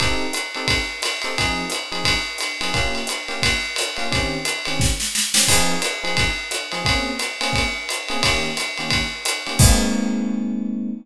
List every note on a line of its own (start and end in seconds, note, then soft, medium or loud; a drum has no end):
0.00 0.26 C4 medium
0.00 0.26 D#4 loud
0.00 0.26 G4 medium
0.00 0.26 A4 medium
0.00 kick medium
0.00 ride medium
0.33 hi-hat pedal medium
0.33 ride medium
0.55 0.77 C4 medium
0.55 0.77 D#4 medium
0.55 0.77 G4 medium
0.55 0.77 A4 medium
0.55 ride medium
0.68 kick medium
0.68 ride loud
1.02 hi-hat pedal medium
1.02 ride medium
1.22 1.34 C4 medium
1.22 1.34 D#4 medium
1.22 1.34 G4 medium
1.22 1.34 A4 medium
1.22 ride medium
1.38 1.64 F3 medium
1.38 1.64 C4 medium
1.38 1.64 D#4 medium
1.38 1.64 G#4 medium
1.38 kick medium
1.38 ride medium
1.70 hi-hat pedal medium
1.70 ride medium
1.92 2.13 F3 medium
1.92 2.13 C4 medium
1.92 2.13 D#4 medium
1.92 2.13 G#4 medium
1.92 ride medium
2.04 kick medium
2.04 ride loud
2.38 hi-hat pedal medium
2.38 ride medium
2.61 2.70 F3 medium
2.61 2.70 C4 medium
2.61 2.70 D#4 medium
2.61 2.70 G#4 medium
2.61 ride medium
2.74 3.00 A#3 medium
2.74 3.00 C#4 medium
2.74 3.00 F4 medium
2.74 3.00 G4 medium
2.74 kick medium
2.74 ride medium
2.95 ride medium
3.07 hi-hat pedal medium
3.07 ride medium
3.28 3.50 A#3 medium
3.28 3.50 C#4 medium
3.28 3.50 F4 medium
3.28 3.50 G4 medium
3.28 ride medium
3.43 kick medium
3.43 ride loud
3.76 hi-hat pedal medium
3.76 ride medium
3.97 4.07 A#3 medium
3.97 4.07 C#4 medium
3.97 4.07 F4 medium
3.97 4.07 G4 medium
3.97 ride medium
4.11 4.37 D#3 medium
4.11 4.37 C4 medium
4.11 4.37 C#4 medium
4.11 4.37 G4 medium
4.11 kick medium
4.11 ride medium
4.45 hi-hat pedal medium
4.45 ride medium
4.65 4.89 D#3 medium
4.65 4.89 C4 medium
4.65 4.89 C#4 medium
4.65 4.89 G4 medium
4.65 ride medium
4.80 kick medium
4.80 snare medium
5.00 snare medium
5.15 snare medium
5.34 5.44 D#3 medium
5.34 5.44 C4 medium
5.34 5.44 C#4 medium
5.34 5.44 G4 medium
5.34 snare loud
5.48 5.75 F3 medium
5.48 5.75 C4 medium
5.48 5.75 D#4 medium
5.48 5.75 G#4 medium
5.48 kick medium
5.48 crash loud
5.48 ride medium
5.82 hi-hat pedal medium
5.82 ride medium
6.03 6.25 F3 medium
6.03 6.25 C4 medium
6.03 6.25 D#4 medium
6.03 6.25 G#4 medium
6.03 ride medium
6.17 kick medium
6.17 ride medium
6.51 hi-hat pedal medium
6.51 ride medium
6.72 6.82 F3 medium
6.72 6.82 C4 medium
6.72 6.82 D#4 medium
6.72 6.82 G#4 medium
6.72 ride medium
6.85 7.11 A#3 medium
6.85 7.11 C4 medium
6.85 7.11 C#4 medium
6.85 7.11 G#4 medium
6.85 kick medium
6.85 ride medium
7.19 hi-hat pedal medium
7.19 ride medium
7.41 7.63 A#3 medium
7.41 7.63 C4 medium
7.41 7.63 C#4 medium
7.41 7.63 G#4 medium
7.41 ride medium
7.53 kick medium
7.53 ride medium
7.89 hi-hat pedal medium
7.89 ride medium
8.08 8.19 A#3 medium
8.08 8.19 C4 medium
8.08 8.19 C#4 medium
8.08 8.19 G#4 medium
8.08 ride medium
8.23 8.49 D#3 medium
8.23 8.49 A#3 medium
8.23 8.49 C#4 medium
8.23 8.49 G4 medium
8.23 kick medium
8.23 ride loud
8.57 hi-hat pedal medium
8.57 ride medium
8.78 9.01 D#3 medium
8.78 9.01 A#3 medium
8.78 9.01 C#4 medium
8.78 9.01 G4 medium
8.78 ride medium
8.90 kick medium
8.90 ride medium
9.25 hi-hat pedal medium
9.25 ride medium
9.47 9.56 D#3 medium
9.47 9.56 A#3 medium
9.47 9.56 C#4 medium
9.47 9.56 G4 medium
9.47 ride medium
9.59 10.91 G#3 loud
9.59 10.91 A#3 loud
9.59 10.91 C4 medium
9.59 10.91 D#4 medium
9.59 kick loud
9.59 crash loud